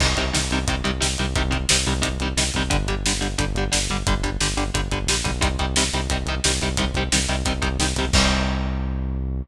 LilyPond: <<
  \new Staff \with { instrumentName = "Overdriven Guitar" } { \clef bass \time 4/4 \key c \minor \tempo 4 = 177 <c ees g>8 <c ees g>8 <c ees g>8 <c ees g>8 <c ees g>8 <c ees g>8 <c ees g>8 <c ees g>8 | <c ees g>8 <c ees g>8 <c ees g>8 <c ees g>8 <c ees g>8 <c ees g>8 <c ees g>8 <c ees g>8 | <d g>8 <d g>8 <d g>8 <d g>8 <d g>8 <d g>8 <d g>8 <d g>8 | <d g>8 <d g>8 <d g>8 <d g>8 <d g>8 <d g>8 <d g>8 <d g>8 |
<c ees g>8 <c ees g>8 <c ees g>8 <c ees g>8 <c ees g>8 <c ees g>8 <c ees g>8 <c ees g>8 | <c ees g>8 <c ees g>8 <c ees g>8 <c ees g>8 <c ees g>8 <c ees g>8 <c ees g>8 <c ees g>8 | <c ees g>1 | }
  \new Staff \with { instrumentName = "Synth Bass 1" } { \clef bass \time 4/4 \key c \minor c,8 c,8 c,8 c,8 c,8 c,8 c,8 c,8 | c,8 c,8 c,8 c,8 c,8 c,8 c,8 c,8 | g,,8 g,,8 g,,8 g,,8 g,,8 g,,8 g,,8 g,,8 | g,,8 g,,8 g,,8 g,,8 g,,8 g,,8 bes,,8 b,,8 |
c,8 c,8 c,8 c,8 c,8 c,8 c,8 c,8 | c,8 c,8 c,8 c,8 c,8 c,8 c,8 c,8 | c,1 | }
  \new DrumStaff \with { instrumentName = "Drums" } \drummode { \time 4/4 <cymc bd>8 <hh bd>8 sn8 hh8 <hh bd>8 hh8 sn8 hh8 | <hh bd>8 <hh bd>8 sn8 hh8 <hh bd>8 hh8 sn8 <hh bd>8 | <hh bd>8 <hh bd>8 sn8 hh8 <hh bd>8 hh8 sn8 <hh bd>8 | <hh bd>8 <hh bd>8 sn8 hh8 <hh bd>8 <hh bd>8 sn8 <hh bd>8 |
<hh bd>8 <hh bd>8 sn8 hh8 <hh bd>8 hh8 sn8 <hh bd>8 | <hh bd>8 <hh bd>8 sn8 hh8 <hh bd>8 <hh bd>8 sn8 <hh bd>8 | <cymc bd>4 r4 r4 r4 | }
>>